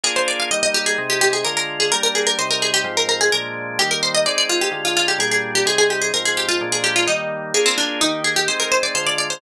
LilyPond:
<<
  \new Staff \with { instrumentName = "Harpsichord" } { \time 4/4 \key ees \major \tempo 4 = 128 aes'16 c''16 d''16 f''16 ees''16 ees''16 g'16 aes'8 g'16 g'16 aes'16 bes'16 bes'8 aes'16 | bes'16 bes'16 aes'16 bes'16 c''16 bes'16 aes'16 g'8 bes'16 bes'16 aes'16 bes'4 | g'16 bes'16 c''16 ees''16 d''16 d''16 f'16 g'8 f'16 f'16 g'16 aes'16 aes'8 g'16 | aes'16 aes'16 g'16 aes'16 bes'16 aes'16 g'16 f'8 aes'16 g'16 f'16 ees'4 |
aes'16 c'16 d'8 ees'8 aes'16 g'16 c''16 bes'16 c''16 d''16 c''16 d''16 d''16 c''16 | }
  \new Staff \with { instrumentName = "Drawbar Organ" } { \time 4/4 \key ees \major <bes d' f' aes'>4 <g bes ees'>4 <c aes ees'>4 <d aes f'>4 | <g bes d'>4 <c g ees'>4 <aes, f c'>4 <bes, f aes d'>4 | <ees g bes>4 <aes c' ees'>4 <d aes f'>4 <bes, g d'>4 | <c g ees'>4 <aes, f c'>4 <bes, f aes d'>4 <ees g bes>4 |
<bes d' f' aes'>4 <ees bes g'>4 <aes c' ees'>4 <d aes f'>4 | }
>>